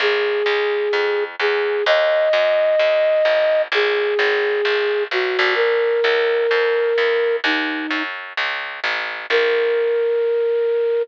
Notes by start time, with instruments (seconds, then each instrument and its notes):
0.00 electric bass (finger) A#1, flute G#4
0.46 electric bass (finger) C#2
0.93 electric bass (finger) F2
1.40 electric bass (finger) E2, flute G#4
1.86 electric bass (finger) D#2, flute D#5
2.33 electric bass (finger) F#2
2.79 electric bass (finger) D#2
3.25 electric bass (finger) A1
3.72 electric bass (finger) A#1, flute G#4
4.19 electric bass (finger) G#1
4.65 electric bass (finger) A#1
5.11 electric bass (finger) B1, flute F#4
5.39 electric bass (finger) A#1
5.55 flute A#4
6.04 electric bass (finger) C#2
6.51 electric bass (finger) F2
6.98 electric bass (finger) E2
7.44 electric bass (finger) D#2, flute D#4
7.91 electric bass (finger) F#2
8.37 electric bass (finger) C#2
8.84 electric bass (finger) A1
9.30 electric bass (finger) A#1, flute A#4